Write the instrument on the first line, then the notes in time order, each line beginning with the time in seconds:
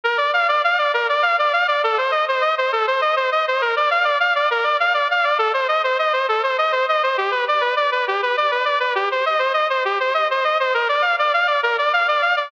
lead 2 (sawtooth)
0.03 A#4
0.17 D5
0.33 F5
0.48 D5
0.64 F5
0.78 D5
0.93 A#4
1.09 D5
1.22 F5
1.38 D5
1.53 F5
1.68 D5
1.83 A4
1.97 C5
2.11 D#5
2.28 C5
2.41 D#5
2.58 C5
2.72 A4
2.87 C5
3.01 D#5
3.16 C5
3.31 D#5
3.47 C5
3.61 A#4
3.76 D5
3.90 F5
4.04 D5
4.20 F5
4.35 D5
4.50 A#4
4.63 D5
4.80 F5
4.94 D5
5.10 F5
5.24 D5
5.38 A4
5.53 C5
5.68 D#5
5.84 C5
5.99 D#5
6.12 C5
6.28 A4
6.43 C5
6.58 D#5
6.72 C5
6.88 D#5
7.03 C5
7.17 G4
7.31 B4
7.48 D5
7.61 B4
7.76 D5
7.91 B4
8.07 G4
8.22 B4
8.37 D5
8.51 B4
8.65 D5
8.80 B4
8.95 G4
9.11 C5
9.25 D#5
9.39 C5
9.53 D#5
9.69 C5
9.85 G4
10.00 C5
10.14 D#5
10.30 C5
10.44 D#5
10.60 C5
10.74 A#4
10.88 D5
11.01 F5
11.19 D5
11.33 F5
11.47 D5
11.62 A#4
11.78 D5
11.93 F5
12.08 D5
12.21 F5
12.36 D5